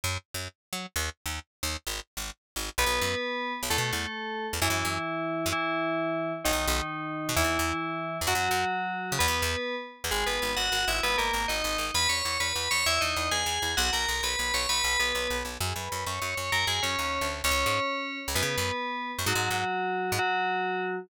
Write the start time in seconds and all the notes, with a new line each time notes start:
0.04 F#2
0.34 F#2
0.73 F#3
0.96 D#2
1.26 D#2
1.63 D#2
1.87 G#1
2.17 G#1
2.56 G#1
2.78 B1 B3 B4
2.86 B1
3.01 F#2
3.63 B1
3.70 E2 A3 A4
3.78 B2
3.93 E2
4.53 E2
4.62 F#2 E3 E4
4.70 F#2
4.85 F#2
5.46 F#2
5.52 E3 E4
6.45 B1 D#3 D#4
6.52 B1
6.67 B1
7.29 B2
7.36 E2 E3 E4
7.44 E2
7.59 E2
8.21 E2
8.27 F#2 F#3 F#4
8.35 F#2
8.51 F#2
9.12 C#3
9.19 E2 B3 B4
9.28 E2
9.42 E2
10.04 E2
10.11 G#1 G#3 G#4
10.26 G#1 B3 B4
10.42 G#1
10.56 G#1 F#4 F#5
10.72 G#1
10.88 G#1 E4 E5
11.03 G#1 B3 B4
11.18 G#1 A#3 A#4
11.33 G#1
11.48 G#1 D#4 D#5
11.64 G#1
11.78 G#1
11.94 E2 B4 B5
12.09 E2 C#5 C#6
12.25 E2
12.40 E2 B4 B5
12.55 E2
12.71 E2 C#5 C#6
12.86 E2 E4 E5
13.01 E2 D#4 D#5
13.16 E2
13.31 E2 G#4 G#5
13.46 E2
13.62 E2
13.77 B1 F#4 F#5
13.93 B1 A#4 A#5
14.08 B1
14.23 B1 B4 B5
14.39 B1
14.54 B1 C#5 C#6
14.69 B1 B4 B5
14.84 B1
14.99 B1 B3 B4
15.15 B1
15.30 B1
15.45 B1
15.60 F#2 G#4 G#5
15.76 F#2 B4 B5
15.92 F#2
16.06 F#2 C#5 C#6
16.22 F#2
16.37 F#2 C#5 C#6
16.52 F#2 A#4 A#5
16.67 F#2 G#4 G#5
16.83 F#2 C#4 C#5
16.99 D#2
17.21 D2
17.44 C#2 C#4 C#5
17.51 C#2
17.66 G#2
18.28 C#2
18.35 F#2 B3 B4
18.42 C#3
18.58 F#2
19.19 F#2
19.26 G#2 F#3 F#4
19.35 G#2
19.51 G#2
20.12 G#2
20.19 F#3 F#4